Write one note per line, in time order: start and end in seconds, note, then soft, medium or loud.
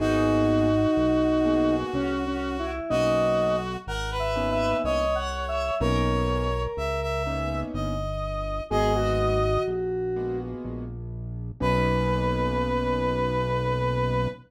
0.00 0.87 G#1 medium
0.00 0.68 A#3 loud
0.00 0.68 B3 loud
0.00 1.75 D#4 loud
0.00 0.68 F#4 loud
0.00 2.71 F#4 loud
0.00 0.68 G#4 loud
0.97 1.84 B1 medium
1.45 2.13 A#3 loud
1.45 2.13 B3 medium
1.45 2.13 F#4 medium
1.45 2.13 G#4 medium
1.94 2.81 C2 medium
1.94 2.25 C#4 loud
2.27 2.57 C#4 medium
2.59 2.90 E4 medium
2.90 3.77 B1 medium
2.90 3.58 A#3 loud
2.90 3.58 B3 loud
2.90 3.58 C#4 loud
2.90 3.58 D#4 loud
2.90 3.77 F#4 loud
2.90 3.56 D#5 loud
3.87 4.74 G#1 medium
3.87 4.10 A#4 loud
3.87 4.18 F#5 medium
4.11 4.77 B4 loud
4.19 4.50 E5 medium
4.35 5.03 A#3 medium
4.35 5.03 B3 medium
4.35 5.03 C#4 loud
4.35 5.03 D#4 medium
4.51 4.82 E5 loud
4.84 5.71 C2 medium
4.84 5.75 C#5 loud
4.84 5.16 D#5 loud
5.15 5.46 F#5 medium
5.48 5.79 E5 medium
5.80 6.68 B1 medium
5.80 6.48 A#3 loud
5.80 6.48 B3 loud
5.80 6.48 C#4 loud
5.80 6.48 D#4 loud
5.80 7.23 A#4 loud
5.80 6.62 C#5 loud
6.77 7.64 C#2 medium
6.77 7.00 E5 medium
7.02 7.60 E5 medium
7.27 7.94 A#3 medium
7.27 7.94 B3 medium
7.27 7.94 C#4 loud
7.27 7.94 D#4 medium
7.74 8.61 G1 medium
7.74 8.63 D#5 medium
8.70 9.58 G#1 medium
8.70 9.39 G#3 loud
8.70 9.39 A#3 loud
8.70 9.39 B3 loud
8.70 9.39 F#4 loud
8.70 8.93 G#4 loud
8.70 9.63 D#5 loud
8.95 10.38 F#4 loud
9.68 10.55 A#1 medium
10.16 10.84 G#3 medium
10.16 10.84 A#3 loud
10.16 10.84 B3 medium
10.16 10.84 F#4 medium
10.65 11.52 A#1 medium
11.60 14.28 B1 loud
11.60 14.27 A#3 loud
11.60 14.27 B3 loud
11.60 14.27 C#4 loud
11.60 14.27 D#4 medium
11.60 14.28 B4 loud